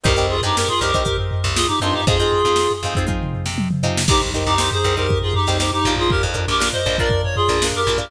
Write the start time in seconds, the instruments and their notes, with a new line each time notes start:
0.04 electric bass (finger) C2, pizzicato strings C4 D#4 G4 A#4, clarinet G4 A#4, kick, floor tom
0.16 electric bass (finger) C2, pizzicato strings C4 D#4 G4 A#4, floor tom
0.29 clarinet F4 G#4
0.42 electric bass (finger) G2, pizzicato strings C4 D#4 G4 A#4, clarinet D#4 G4, floor tom
0.56 clarinet G4 A#4, snare
0.68 clarinet F4 G#4, floor tom
0.80 electric bass (finger) C2, pizzicato strings C4 D#4 G4 A#4, clarinet G4 A#4, floor tom
0.94 pizzicato strings C4 D#4 G4 A#4, kick, floor tom
1.05 pizzicato strings C4 D#4 G4 A#4, kick, floor tom
1.18 floor tom
1.31 floor tom
1.44 electric bass (finger) C2, snare, floor tom
1.55 clarinet F4 G#4, snare
1.68 clarinet D#4 G4, floor tom
1.80 electric bass (finger) G2, pizzicato strings C4 D#4 G4 A#4, clarinet D4 F4, floor tom
1.93 clarinet D#4 G4, floor tom
2.07 electric bass (finger) F2, pizzicato strings C4 D#4 F4 G#4, clarinet F4 G#4, kick, floor tom
2.18 electric bass (finger) F2, pizzicato strings C4 D#4 F4 G#4, floor tom
2.32 floor tom
2.44 electric bass (finger) F2, pizzicato strings C4 D#4 F4 G#4, floor tom
2.56 snare
2.69 snare, floor tom
2.83 electric bass (finger) F2, pizzicato strings C4 D#4 F4 G#4, floor tom
2.94 pizzicato strings C4 D#4 F4, kick, floor tom
2.99 pizzicato strings G#4
3.07 pizzicato strings C4 D#4 F4 G#4, kick, high tom
3.21 mid tom
3.33 floor tom
3.46 electric bass (finger) C3, snare
3.58 high tom
3.71 mid tom
3.83 electric bass (finger) C3, pizzicato strings C4 D#4 F4 G#4, floor tom
3.97 snare
4.08 electric bass (finger) C2, clarinet D#4 G4, pizzicato strings D#4 G4 A#4, kick, crash
4.12 pizzicato strings C5
4.21 electric bass (finger) C2, snare, floor tom
4.34 pizzicato strings D#4 G4 A#4 C5, floor tom
4.46 electric bass (finger) C2, clarinet D#4 G4, floor tom
4.58 pizzicato strings D#4 G4 A#4 C5, snare
4.71 clarinet G#4 C5, floor tom
4.84 electric bass (finger) C2, pizzicato strings D#4 G4 A#4 C5, floor tom
4.97 pizzicato strings D#4 G4 A#4 C5, clarinet G4 A#4, floor tom
5.09 kick, floor tom
5.22 clarinet F4 G#4, floor tom
5.34 clarinet D#4 G4, floor tom
5.47 electric bass (finger) C2, pizzicato strings D#4 G4 A#4 C5, snare, floor tom
5.60 pizzicato strings D#4 G4 A#4 C5, snare
5.71 clarinet D#4 G4, floor tom
5.85 electric bass (finger) A#1, pizzicato strings D4 F4 A#4, floor tom
5.96 clarinet F4 G#4, floor tom
6.10 clarinet G4 A#4, kick, floor tom
6.23 electric bass (finger) F2, floor tom
6.34 pizzicato strings D4 F4 A#4, floor tom
6.47 electric bass (finger) A#1, clarinet G4 A#4, floor tom
6.60 pizzicato strings D4 F4 A#4, snare
6.72 clarinet C5 D#5, floor tom
6.86 electric bass (finger) A#1, pizzicato strings D4 F4 A#4, floor tom
6.98 pizzicato strings D4 F4 A#4, clarinet A#4 D5, kick
7.10 kick, floor tom
7.24 clarinet C#5, floor tom
7.36 clarinet F4 G#4, floor tom
7.48 electric bass (finger) A#1, pizzicato strings D4 F4 A#4, snare, floor tom
7.62 pizzicato strings D4 F4 A#4, snare
7.73 clarinet G4 A#4, floor tom
7.87 electric bass (finger) A#1, pizzicato strings D4 F4 A#4, snare, floor tom
7.98 pizzicato strings D4 F4 A#4, clarinet G4 A#4, floor tom